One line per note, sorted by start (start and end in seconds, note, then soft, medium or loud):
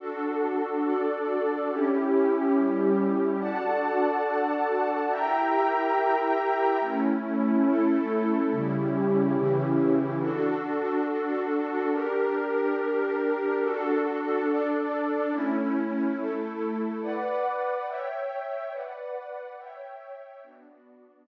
0.00 0.84 D4 medium
0.00 1.69 D4 medium
0.00 0.84 F#4 medium
0.00 1.69 F#4 medium
0.00 0.84 A4 medium
0.00 1.69 A4 medium
0.85 1.69 D4 medium
0.85 1.69 A4 medium
0.85 1.69 D5 medium
1.69 3.38 C#4 medium
1.69 2.54 C#4 medium
1.69 3.38 E4 medium
1.69 2.54 E4 medium
1.69 3.38 G4 medium
1.69 2.54 G4 medium
2.55 3.40 G3 medium
2.55 3.40 C#4 medium
2.55 3.40 G4 medium
3.40 5.09 D4 medium
3.40 5.09 F#4 medium
3.40 5.09 A4 medium
3.40 5.09 D5 medium
3.40 5.09 F#5 medium
3.40 5.09 A5 medium
5.11 6.79 E4 medium
5.11 6.79 G4 medium
5.11 6.79 A#4 medium
5.11 6.79 E5 medium
5.11 6.79 G5 medium
5.11 6.79 A#5 medium
6.80 8.49 A3 medium
6.80 7.65 A3 medium
6.80 8.49 C#4 medium
6.80 7.65 C#4 medium
6.80 8.49 E4 medium
6.80 7.65 E4 medium
7.66 8.50 A3 medium
7.66 8.50 E4 medium
7.66 8.50 A4 medium
8.50 9.35 C#3 medium
8.50 9.35 G3 medium
8.50 10.19 C#4 medium
8.50 10.19 E4 medium
8.50 9.35 E4 medium
8.50 10.19 G4 medium
9.36 10.20 C#3 medium
9.36 10.20 E3 medium
9.36 10.20 E4 medium
10.21 11.90 D4 medium
10.21 11.90 F#4 medium
10.21 11.90 A4 medium
11.91 13.60 D4 medium
11.91 13.60 G4 medium
11.91 13.60 A#4 medium
13.62 14.46 D4 medium
13.62 14.46 F#4 medium
13.62 14.46 A4 medium
14.47 15.31 D4 medium
14.47 15.31 A4 medium
14.47 15.31 D5 medium
15.32 16.16 A3 medium
15.32 16.16 C#4 medium
15.32 16.16 E4 medium
16.17 17.01 A3 medium
16.17 17.01 E4 medium
16.17 17.01 A4 medium
17.02 17.86 B4 medium
17.02 17.86 D5 medium
17.02 17.86 F#5 medium
17.02 17.86 D6 medium
17.87 18.71 C#5 medium
17.87 18.72 C#5 medium
17.87 18.71 E5 medium
17.87 18.72 E5 medium
17.87 18.71 G5 medium
17.87 18.72 G5 medium
18.72 19.56 B4 medium
18.72 19.57 B4 medium
18.72 19.56 D5 medium
18.72 19.57 D5 medium
18.72 19.56 F#5 medium
18.72 19.57 F#5 medium
19.57 20.42 C#5 medium
19.57 20.42 E5 medium
19.57 20.42 G5 medium
20.42 21.26 B3 medium
20.42 21.27 B3 medium
20.42 21.27 D4 medium
20.42 21.26 F#4 medium
20.42 21.27 F#4 medium
20.42 21.26 D5 medium